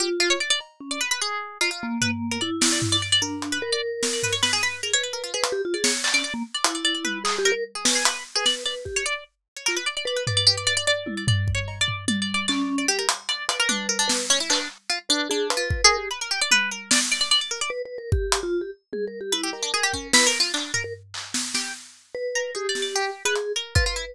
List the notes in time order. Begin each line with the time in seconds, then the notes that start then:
0.00 F4 G4
0.20 F4
0.30 C#5
0.40 D5
0.50 D5
0.60 cowbell
0.80 C#4
0.91 D5
1.01 B4
1.11 B4
1.21 G#4
1.61 F4, cowbell
1.71 F4
1.83 A#3
2.01 B4, floor tom
2.31 A#4
2.41 E4 D5
2.61 D5, snare
2.72 D5
2.82 floor tom
2.92 D5
3.02 D5
3.12 D5
3.22 D4 A#4
3.42 closed hi-hat
3.52 B4
3.62 A#4
3.72 D5
4.03 C#5, snare
4.13 D5
4.23 B4, floor tom
4.33 C#5
4.43 B4, snare
4.53 G#4
4.63 B4
4.83 G#4 A#4
4.93 B4 C#5
5.03 B4
5.13 A#4
5.24 F4
5.34 G#4 B4
5.43 B4, closed hi-hat
5.52 G4
5.65 F4
5.74 G#4 D5
5.84 C#5, snare
6.04 D5, clap
6.14 C#4 D5
6.24 D5
6.34 A#3
6.54 D5
6.64 E4, closed hi-hat
6.75 D5
6.85 D5
6.95 D5
7.05 B4, high tom
7.24 G#4, clap
7.39 G4
7.45 A#4
7.52 A#4
7.75 G#4
7.85 C#4 B4, snare
7.95 G#4
8.05 B4, closed hi-hat
8.35 G#4 B4
8.46 D5, snare
8.66 B4 D5
8.85 G4, kick
8.96 C#5
9.06 D5
9.57 C#5
9.66 F4 A#4, clap
9.77 B4
9.86 D5
9.97 D5
10.05 B4 D5
10.16 B4
10.27 B4 D5, floor tom
10.37 D5
10.47 G4
10.57 D5
10.67 D5
10.77 D5
10.87 D5
11.06 E4, high tom
11.17 D5
11.28 D5, floor tom
11.48 kick
11.55 C#5
11.68 cowbell
11.81 D5
11.88 floor tom
12.08 D5, high tom
12.22 D5
12.34 D5
12.48 C#4 D5, clap
12.78 D5
12.88 G4
12.99 A#4
13.09 closed hi-hat
13.29 D5, closed hi-hat
13.49 B4 D5, closed hi-hat
13.60 A#4
13.69 D4, high tom
13.89 A#4
13.99 D4
14.08 B4, snare
14.30 C#4
14.40 E4
14.50 D4 B4, clap
14.90 F4
15.09 D4 B4
15.30 D4 G#4
15.50 B4, closed hi-hat
15.57 F4
15.70 B4, kick
15.84 G#4 A#4
15.97 G4
16.11 B4
16.21 A#4
16.31 G4
16.41 D5
16.51 B4, high tom
16.71 A#4
16.91 D5, snare
17.12 D5
17.21 D5
17.31 D5
17.41 D5
17.51 A#4
17.61 D5
17.70 B4
17.85 B4
17.98 A#4
18.12 G4, kick
18.32 closed hi-hat
18.43 F4
18.61 G4
18.93 G#4, high tom
19.07 A#4
19.21 G4
19.32 E4 B4
19.43 G4
19.53 A#4, cowbell
19.63 D4
19.74 G#4
19.83 G4
19.93 C#4, kick
20.13 E4 B4, snare
20.27 A#4
20.40 F4
20.54 D4, clap
20.74 A#4, floor tom
20.84 A#4
21.14 clap
21.34 snare
21.54 G4, snare
22.15 B4
22.35 A#4
22.55 G4 G#4
22.69 D5
22.75 snare
22.82 D5
22.96 G4
23.25 G#4 B4
23.36 closed hi-hat
23.56 A#4
23.75 F4 B4, kick
23.86 F4 B4
23.96 E4